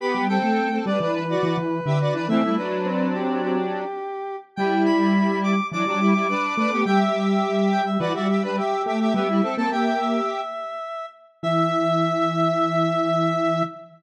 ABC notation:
X:1
M:4/4
L:1/16
Q:1/4=105
K:Em
V:1 name="Lead 1 (square)"
b2 g4 d2 B8 | e2 B4 G2 G8 | g2 b4 d'2 d'8 | g e2 z3 g e B e2 B G3 G |
e3 a g g e8 z2 | e16 |]
V:2 name="Lead 1 (square)"
[B,G]2 [CA]3 [CA] [DB] [DB]2 [Fd]2 z2 [Ge] [Fd] [DB] | [E,C] [G,E] [F,D]10 z4 | [G,E]8 [F,D] [F,D] [G,E] [G,E] [DB]2 [DB] [B,G] | [Ge]8 [Fd] [Fd] [Ge] [DB] [Ge]2 [Ge] [Ge] |
[B,G] [G,E] [CA] [CA] [Ge]6 z6 | e16 |]
V:3 name="Lead 1 (square)"
z G,2 A,3 G, E,3 E, E,2 D,2 E, | A,2 z2 C6 z6 | G,8 E, G,4 z A,2 | G,8 E, G,4 z A,2 |
G,2 z ^A,5 z8 | E,16 |]